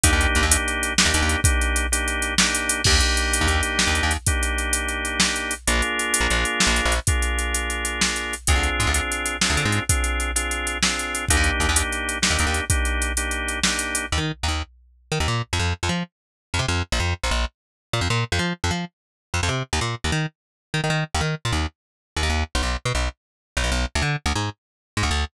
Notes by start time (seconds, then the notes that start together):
0.04 D#2 A#3 D4 D#4 G4, kick, closed hi-hat
0.13 D#2
0.21 closed hi-hat
0.35 D#2, closed hi-hat
0.43 D#2
0.51 A#3 D4 D#4 G4, closed hi-hat
0.68 closed hi-hat
0.83 closed hi-hat
0.98 A#3 D4 D#4 G4, snare
1.05 D#2
1.14 D#2, closed hi-hat
1.22 D#2
1.29 closed hi-hat
1.44 A#3 D4 D#4 G4, kick, closed hi-hat
1.61 closed hi-hat
1.76 closed hi-hat
1.92 A#3 D4 D#4 G4, closed hi-hat
2.08 closed hi-hat
2.22 closed hi-hat
2.38 A#3 D4 D#4 G4, snare
2.55 closed hi-hat
2.69 closed hi-hat
2.84 D#2 A#3 D4 D#4 G4, kick, crash
3.00 closed hi-hat
3.17 closed hi-hat
3.33 closed hi-hat
3.41 D#2
3.47 D#2, closed hi-hat
3.63 closed hi-hat
3.79 snare
3.87 D#2
3.95 closed hi-hat
4.03 D#2
4.11 closed hi-hat
4.26 A#3 D4 D#4 G4, kick, closed hi-hat
4.43 closed hi-hat
4.58 closed hi-hat
4.73 closed hi-hat
4.88 closed hi-hat
5.05 closed hi-hat
5.20 snare
5.36 closed hi-hat
5.51 closed hi-hat
5.67 A#1 A#3 D4 F4 G#4, closed hi-hat
5.82 closed hi-hat
5.99 closed hi-hat
6.14 closed hi-hat
6.20 A#1
6.30 A#1, closed hi-hat
6.45 closed hi-hat
6.60 snare
6.67 A#1
6.76 closed hi-hat
6.85 A#1
6.92 closed hi-hat
7.07 A#3 D4 F4 G#4, kick, closed hi-hat
7.22 closed hi-hat
7.39 closed hi-hat
7.54 closed hi-hat
7.70 closed hi-hat
7.85 closed hi-hat
8.01 snare
8.16 closed hi-hat
8.33 closed hi-hat
8.47 D2 C4 D4 F4 G#4, kick, closed hi-hat
8.55 D2
8.63 closed hi-hat
8.80 G#2, closed hi-hat
8.87 D2
8.94 C4 D4 F4 G#4, closed hi-hat
9.12 closed hi-hat
9.26 closed hi-hat
9.41 C4 D4 F4 G#4, snare
9.50 D2
9.57 D3, closed hi-hat
9.65 G#2
9.72 closed hi-hat
9.89 C4 D4 F4 G#4, kick, closed hi-hat
10.04 closed hi-hat
10.20 closed hi-hat
10.36 C4 D4 F4 G#4, closed hi-hat
10.51 closed hi-hat
10.67 closed hi-hat
10.83 C4 D4 F4 G#4, snare
10.99 closed hi-hat
11.15 closed hi-hat
11.28 D#2 A#3 D4 D#4 G4, kick, closed hi-hat
11.37 D#2
11.44 closed hi-hat
11.60 D#2, closed hi-hat
11.69 D#2
11.76 A#3 D4 D#4 G4, closed hi-hat
11.92 closed hi-hat
12.09 closed hi-hat
12.22 A#3 D4 D#4 G4, snare
12.30 D#2
12.39 D#2, closed hi-hat
12.46 D#2
12.54 closed hi-hat
12.70 A#3 D4 D#4 G4, kick, closed hi-hat
12.85 closed hi-hat
13.02 closed hi-hat
13.17 A#3 D4 D#4 G4, closed hi-hat
13.31 closed hi-hat
13.48 closed hi-hat
13.63 A#3 D4 D#4 G4, snare
13.79 closed hi-hat
13.95 closed hi-hat
14.12 D#2
14.18 D#3
14.43 D#2
14.48 D#2
15.12 D#3
15.20 D#2
15.28 A#2
15.53 F2
15.59 F2
15.83 F2
15.89 F3
16.54 F2
16.59 C3
16.68 F2
16.92 A#1
17.00 F2
17.24 A#1
17.31 A#1
17.93 A#2
18.01 F2
18.10 A#2
18.32 F2
18.39 F3
18.64 F2
18.71 F3
19.34 F2
19.43 F2
19.49 C3
19.73 D#2
19.81 A#2
20.04 D#2
20.12 D#3
20.74 D#3
20.84 D#3
20.90 D#3
21.14 D#2
21.21 D#3
21.45 A#2
21.52 D#2
22.16 D#2
22.23 D#2
22.30 D#2
22.55 B1
22.62 B1
22.85 B2
22.95 B1
23.57 B1
23.64 B1
23.72 B1
23.95 D2
24.02 D3
24.26 D2
24.35 G#2
24.97 G#2
25.03 D2
25.11 D2